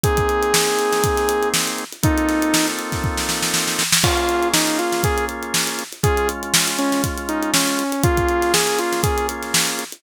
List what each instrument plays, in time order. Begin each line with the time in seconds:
0.04 drawbar organ A#3 C4 D#4 G#4, lead 2 (sawtooth) G#4, kick, closed hi-hat
0.17 kick, closed hi-hat
0.29 closed hi-hat
0.43 closed hi-hat
0.54 snare
0.67 snare, closed hi-hat
0.79 closed hi-hat
0.92 snare, closed hi-hat
1.04 kick, closed hi-hat
1.17 snare, closed hi-hat
1.29 closed hi-hat
1.43 closed hi-hat
1.54 snare
1.68 closed hi-hat
1.78 closed hi-hat
1.93 closed hi-hat
2.03 drawbar organ A#3 C4 D#4 F4 A4, lead 2 (sawtooth) D#4, kick, closed hi-hat
2.18 closed hi-hat
2.29 snare, closed hi-hat
2.42 closed hi-hat
2.54 snare
2.68 snare, closed hi-hat
2.79 closed hi-hat
2.92 kick, snare, closed hi-hat
3.04 kick
3.17 snare
3.29 snare
3.42 snare
3.54 snare
3.67 snare
3.79 snare
3.92 snare
4.03 drawbar organ A#3 C#4 F4 G#4, lead 2 (sawtooth) F4, kick, crash
4.17 closed hi-hat
4.29 closed hi-hat
4.42 closed hi-hat
4.54 lead 2 (sawtooth) D#4, snare
4.67 snare, closed hi-hat
4.79 lead 2 (sawtooth) F4, closed hi-hat
4.92 snare, closed hi-hat
5.04 lead 2 (sawtooth) G#4, kick, closed hi-hat
5.18 closed hi-hat
5.29 closed hi-hat
5.43 closed hi-hat
5.54 snare
5.67 closed hi-hat
5.79 snare, closed hi-hat
5.92 closed hi-hat
6.03 drawbar organ G#3 C#4 F4, lead 2 (sawtooth) G#4, kick, closed hi-hat
6.17 closed hi-hat
6.29 closed hi-hat
6.43 closed hi-hat
6.54 snare
6.68 closed hi-hat
6.79 lead 2 (sawtooth) C#4, closed hi-hat
6.92 snare, closed hi-hat
7.04 kick, closed hi-hat
7.17 closed hi-hat
7.29 lead 2 (sawtooth) D#4, closed hi-hat
7.43 closed hi-hat
7.54 lead 2 (sawtooth) C#4, snare
7.67 closed hi-hat
7.79 closed hi-hat
7.92 closed hi-hat
8.03 drawbar organ A#3 C#4 F4 G#4, lead 2 (sawtooth) F4, kick, closed hi-hat
8.17 kick, closed hi-hat
8.29 closed hi-hat
8.42 snare, closed hi-hat
8.54 lead 2 (sawtooth) G#4, snare
8.67 closed hi-hat
8.79 lead 2 (sawtooth) F4, closed hi-hat
8.92 snare, closed hi-hat
9.03 lead 2 (sawtooth) G#4, kick, closed hi-hat
9.18 closed hi-hat
9.29 closed hi-hat
9.43 snare, closed hi-hat
9.54 snare
9.68 closed hi-hat
9.79 closed hi-hat
9.92 closed hi-hat